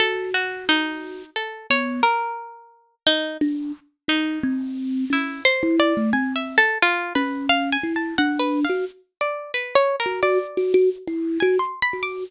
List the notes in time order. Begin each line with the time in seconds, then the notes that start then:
0.00 F#4 A4
0.34 F#4
0.69 D#4
1.36 A4
1.70 B3 C#5
2.03 A#4
3.07 D#4
3.41 D4
4.08 D#4
4.43 C4
5.10 C#4 E4
5.45 C5
5.63 E4
5.80 D5
5.97 A3
6.13 C4 G#5
6.36 E5
6.58 A4
6.82 F4
7.15 C#4 B4
7.49 F5
7.72 G#5
7.83 E4
7.96 A5
8.18 D4 F#5
8.39 B4
8.64 F5
8.69 F#4
9.21 D5
9.54 B4
9.75 C#5
10.00 A#4
10.06 F#4
10.23 F#4 D5
10.57 F#4
10.74 F#4
11.08 E4
11.40 F#4 G#5
11.59 C6
11.82 B5
11.93 F#4
12.03 D6